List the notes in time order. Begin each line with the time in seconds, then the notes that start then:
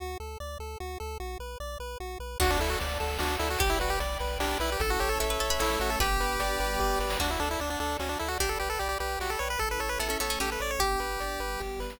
0.00 D2 F#4
0.20 D2 A4
0.40 D2 D5
0.59 D2 A4
0.80 D2 F#4
1.00 D2 A4
1.20 B1 F#4
1.39 B1 B4
1.60 B1 D5
1.80 B1 B4
2.00 B1 F#4
2.20 B1 B4
2.40 D2 D4 F#4 D5 F#5 A5, kick, crash
2.51 D4
2.59 D2 E4 A4, closed hi-hat
2.70 F#4
2.80 D2 D5, closed hi-hat
3.00 D2 A4, closed hi-hat
3.19 D2 D4 F#4, snare
3.39 D2 E4 A4, closed hi-hat
3.50 F#4
3.59 B1 G4 D5 G5 B5, kick, closed hi-hat
3.70 E4
3.80 B1 F#4 B4, closed hi-hat
3.90 G4
4.00 B1 D5, closed hi-hat
4.19 B1 B4, closed hi-hat
4.39 B1 D4 G4, snare
4.60 B1 E4 B4
4.72 G4
4.80 A1 C#4 E4 A4, kick, closed hi-hat
4.90 F#4
5.00 A1 G4 C#5, closed hi-hat
5.09 A4
5.20 A1 A4 E5, closed hi-hat
5.30 B4
5.39 A1 A3 C#4 A4 C#5, closed hi-hat
5.50 B4
5.59 A1 E4 A4 C#5, snare
5.79 A1 F#4 C#5, closed hi-hat
5.90 A4
5.99 G1 B3 D4 G4 B4, kick, closed hi-hat
6.20 G1 B4, closed hi-hat
6.40 G1 D5, closed hi-hat
6.60 G1 G3 B3 G4 B4, closed hi-hat
6.79 G1 G4, kick, snare
6.99 G1 B4, snare
7.10 snare
7.19 D2 D4 F#4 D5 F#5 A5, kick, crash
7.31 E4
7.40 D2 D4 A4, closed hi-hat
7.51 E4
7.60 D2 D4 D5, closed hi-hat
7.70 D4
7.79 D2 D4 A4, closed hi-hat
7.99 D2 C#4 F#4, snare
8.09 D4
8.19 D2 E4 A4, closed hi-hat
8.28 F#4
8.39 B1 D4 G4 D5 G5 B5, kick, closed hi-hat
8.49 A4
8.60 B1 G4 B4, closed hi-hat
8.70 A4
8.79 B1 G4 D5, closed hi-hat
8.89 G4
9.00 B1 G4 B4, closed hi-hat
9.19 B1 F#4 G4, snare
9.30 A4
9.39 B1 B4 C#5
9.50 B4
9.59 A1 C#4 E4 A4, kick, closed hi-hat
9.71 B4
9.80 A1 A4 C#5, closed hi-hat
9.89 B4
9.99 A1 B3 A4 E5, closed hi-hat
10.08 C#4 A4
10.20 A1 A3 B3 C#4 A4 C#5, closed hi-hat
10.30 C#4
10.40 A1 C#4 G4 A4, snare
10.52 B4
10.60 A1 C#5 D5, closed hi-hat
10.71 C#5
10.79 G1 B3 D4 G4, kick, closed hi-hat
10.99 G1 B4, closed hi-hat
11.20 G1 D5, closed hi-hat
11.40 G1 G3 B3 G4 B4, closed hi-hat
11.60 G1 G4, kick, snare
11.79 G1 B4, snare
11.90 snare